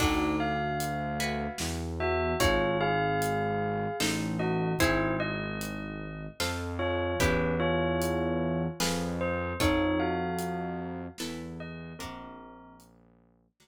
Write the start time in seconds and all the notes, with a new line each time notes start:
0.00 D2 D4 D#4 F#4 A4 D5, kick, crash
0.40 F5
0.80 closed hi-hat
1.20 E4 F#4 B4
1.58 E2, snare
2.00 F#4 E5
2.40 G#1 D#4 F4 G#4 C#5, kick, closed hi-hat
2.81 G#4 F5
3.22 closed hi-hat
4.00 A1 D#4 A4 C5, snare
4.39 F#4 D#5
4.79 G#1 E4 G#4 C5, kick, closed hi-hat
5.20 D#5
5.61 closed hi-hat
6.40 F2 F4 A4 C5, snare
6.79 F4 C#5
7.20 E2 C#4 E4 G4 B4, kick, closed hi-hat
7.60 F4 C#5
8.02 closed hi-hat
8.80 F2 F4 G#4 B4, snare
9.21 C5
9.60 F2 D#4 F4 A4 C#5, kick, closed hi-hat
10.00 F#4 F5
10.39 closed hi-hat
11.18 E2 E4 A4 B4, snare
11.60 D#5
11.99 A#1 C4 D4 F#4 A#4, kick, closed hi-hat
12.80 closed hi-hat
13.60 D2 D4 F#4 A#4, snare